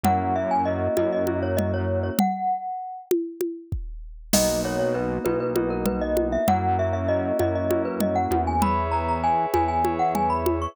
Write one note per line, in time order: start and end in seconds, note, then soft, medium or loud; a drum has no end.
0.04 0.88 F#2 medium
0.04 0.33 A#3 medium
0.04 0.33 C#4 loud
0.04 0.33 E4 loud
0.04 0.33 F#4 loud
0.04 0.34 F#5 medium
0.04 low conga medium
0.35 0.64 A#3 medium
0.35 0.64 C#4 medium
0.35 0.64 E4 medium
0.35 0.64 F#4 medium
0.35 0.50 E5 medium
0.51 0.66 G#5 medium
0.65 0.94 A#3 medium
0.65 0.94 C#4 medium
0.65 0.94 E4 medium
0.65 0.94 F#4 medium
0.65 0.95 D#5 medium
0.97 2.10 F#2 medium
0.97 1.25 A#3 medium
0.97 1.25 C#4 medium
0.97 1.25 E4 loud
0.97 1.25 F#4 medium
0.97 1.11 D#5 loud
0.97 high conga medium
1.13 1.38 D#5 medium
1.27 2.12 A#3 medium
1.27 2.12 C#4 medium
1.27 2.12 E4 medium
1.27 2.12 F#4 loud
1.27 high conga medium
1.43 1.57 C#5 medium
1.57 1.71 D#5 medium
1.57 low conga medium
1.74 1.99 C#5 medium
2.03 2.18 C#5 medium
2.19 3.05 F#5 loud
2.19 low conga loud
3.11 high conga medium
3.41 high conga medium
3.72 kick medium
4.33 5.19 B1 medium
4.33 4.62 A#3 loud
4.33 4.62 B3 loud
4.33 4.62 D#4 loud
4.33 4.62 F#4 loud
4.33 4.61 D#5 loud
4.33 crash loud
4.33 low conga loud
4.64 4.92 A#3 medium
4.64 4.92 B3 medium
4.64 4.92 D#4 loud
4.64 4.92 F#4 loud
4.64 4.79 C#5 loud
4.79 4.94 C#5 medium
4.94 5.23 A#3 medium
4.94 5.23 B3 medium
4.94 5.23 D#4 medium
4.94 5.23 F#4 loud
4.94 5.19 B4 medium
5.24 6.38 B1 medium
5.24 5.53 A#3 loud
5.24 5.53 B3 loud
5.24 5.53 D#4 loud
5.24 5.53 F#4 medium
5.24 5.39 B4 medium
5.24 high conga medium
5.40 5.70 B4 medium
5.56 6.40 A#3 medium
5.56 6.40 B3 medium
5.56 6.40 D#4 loud
5.56 6.40 F#4 medium
5.56 high conga medium
5.70 5.85 A#4 loud
5.86 6.01 B4 medium
5.86 low conga medium
6.01 6.28 D#5 medium
6.17 high conga medium
6.32 6.47 E5 medium
6.48 7.32 F#2 medium
6.48 6.76 A#3 loud
6.48 6.76 C#4 medium
6.48 6.76 E4 loud
6.48 6.76 F#4 loud
6.48 6.77 F#5 loud
6.48 low conga loud
6.78 7.07 A#3 medium
6.78 7.07 C#4 medium
6.78 7.07 E4 medium
6.78 7.07 F#4 medium
6.78 6.93 E5 loud
6.93 7.08 E5 medium
7.08 7.37 A#3 medium
7.08 7.37 C#4 medium
7.08 7.37 E4 medium
7.08 7.37 F#4 medium
7.08 7.38 D#5 loud
7.39 8.27 F#2 medium
7.39 7.68 A#3 medium
7.39 7.68 C#4 medium
7.39 7.68 E4 medium
7.39 7.68 F#4 medium
7.39 7.55 D#5 loud
7.39 high conga medium
7.55 7.83 D#5 medium
7.70 8.55 A#3 medium
7.70 8.55 C#4 medium
7.70 8.55 E4 loud
7.70 8.55 F#4 medium
7.70 high conga medium
7.85 8.00 B4 medium
8.01 8.16 D#5 medium
8.01 low conga medium
8.16 8.41 F#5 medium
8.31 9.46 E2 medium
8.31 high conga medium
8.47 8.62 G#5 medium
8.62 8.90 G#4 loud
8.62 8.90 B4 loud
8.62 8.90 C#5 loud
8.62 8.90 E5 loud
8.62 8.90 B5 loud
8.62 low conga loud
8.91 9.21 G#4 medium
8.91 9.21 B4 loud
8.91 9.21 C#5 medium
8.91 9.21 E5 loud
8.91 9.06 A#5 medium
9.09 9.23 A#5 medium
9.23 9.51 G#4 medium
9.23 9.51 B4 medium
9.23 9.51 C#5 medium
9.23 9.51 E5 medium
9.23 9.51 G#5 medium
9.54 10.67 E2 medium
9.54 9.82 G#4 medium
9.54 9.82 B4 medium
9.54 9.82 C#5 medium
9.54 9.82 E5 medium
9.54 9.68 G#5 medium
9.54 high conga medium
9.68 9.94 G#5 medium
9.84 10.69 G#4 medium
9.84 10.69 B4 medium
9.84 10.69 C#5 medium
9.84 10.69 E5 medium
9.84 high conga medium
9.99 10.14 F#5 medium
10.15 10.29 G#5 medium
10.15 low conga medium
10.30 10.59 B5 medium
10.46 high conga medium
10.62 10.76 C#6 medium